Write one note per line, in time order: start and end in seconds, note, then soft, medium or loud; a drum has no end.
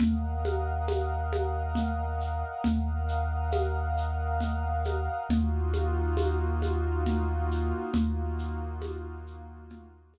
0.00 2.44 D#2 medium
0.00 2.62 A#4 medium
0.00 2.62 D#5 medium
0.00 2.62 F5 medium
0.00 2.62 F#5 medium
0.00 low conga loud
0.00 shaker medium
0.44 high conga medium
0.44 shaker medium
0.88 tambourine medium
0.88 high conga medium
0.88 shaker medium
1.33 high conga medium
1.33 shaker medium
1.75 low conga medium
1.75 shaker medium
2.20 shaker medium
2.64 5.08 D#2 loud
2.64 5.27 A#4 medium
2.64 5.27 D#5 medium
2.64 5.27 F5 medium
2.64 5.27 F#5 medium
2.64 low conga medium
2.64 shaker medium
3.08 shaker medium
3.52 tambourine medium
3.52 high conga medium
3.52 shaker medium
3.97 shaker medium
4.40 low conga medium
4.40 shaker medium
4.85 high conga medium
4.85 shaker medium
5.29 7.73 D#2 loud
5.29 7.92 A#3 medium
5.29 7.92 D#4 medium
5.29 7.92 F4 loud
5.29 7.92 F#4 medium
5.29 low conga medium
5.29 shaker medium
5.73 high conga medium
5.73 shaker medium
6.17 tambourine medium
6.17 high conga medium
6.17 shaker medium
6.62 high conga medium
6.62 shaker medium
7.06 low conga medium
7.06 shaker medium
7.51 shaker medium
7.94 10.18 D#2 loud
7.94 10.18 A#3 medium
7.94 10.18 D#4 medium
7.94 10.18 F4 medium
7.94 10.18 F#4 medium
7.94 low conga medium
7.94 shaker medium
8.39 shaker medium
8.82 tambourine medium
8.82 high conga medium
8.82 shaker medium
9.27 shaker medium
9.70 low conga medium
9.70 shaker medium
10.14 high conga medium
10.14 shaker medium